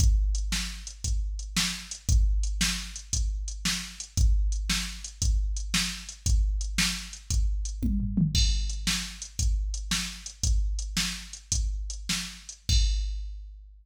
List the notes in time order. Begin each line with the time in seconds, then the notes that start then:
0.00 kick, closed hi-hat
0.35 closed hi-hat
0.52 snare
0.87 closed hi-hat
1.04 kick, closed hi-hat
1.39 closed hi-hat
1.57 snare
1.91 closed hi-hat
2.09 kick, closed hi-hat
2.43 closed hi-hat
2.61 snare
2.96 closed hi-hat
3.13 kick, closed hi-hat
3.48 closed hi-hat
3.65 snare
4.00 closed hi-hat
4.17 kick, closed hi-hat
4.52 closed hi-hat
4.70 snare
5.04 closed hi-hat
5.22 kick, closed hi-hat
5.57 closed hi-hat
5.74 snare
6.09 closed hi-hat
6.26 kick, closed hi-hat
6.61 closed hi-hat
6.78 snare
7.13 closed hi-hat
7.30 kick, closed hi-hat
7.65 closed hi-hat
7.83 kick, high tom
8.00 floor tom
8.17 mid tom
8.35 kick, crash
8.69 closed hi-hat
8.87 snare
9.22 closed hi-hat
9.39 kick, closed hi-hat
9.74 closed hi-hat
9.91 snare
10.26 closed hi-hat
10.43 kick, closed hi-hat
10.79 closed hi-hat
10.97 snare
11.33 closed hi-hat
11.52 kick, closed hi-hat
11.90 closed hi-hat
12.09 snare
12.49 closed hi-hat
12.69 kick, crash